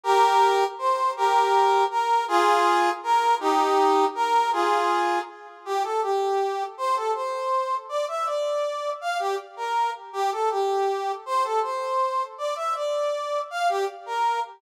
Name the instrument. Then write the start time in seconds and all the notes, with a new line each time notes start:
brass section
0.04 G4 A#4
0.78 C5
1.17 G4 A#4
1.90 A#4
2.28 F4 G#4
3.03 A#4
3.40 D#4 G4
4.15 A#4
4.52 F4 G#4
5.65 G4
5.83 A4
6.02 G4
6.78 C5
6.96 A4
7.15 C5
7.89 D5
8.08 E5
8.26 D5
9.01 F5
9.19 G4
9.57 A#4
10.13 G4
10.32 A4
10.51 G4
11.26 C5
11.44 A4
11.63 C5
12.38 D5
12.56 E5
12.75 D5
13.50 F5
13.69 G4
14.06 A#4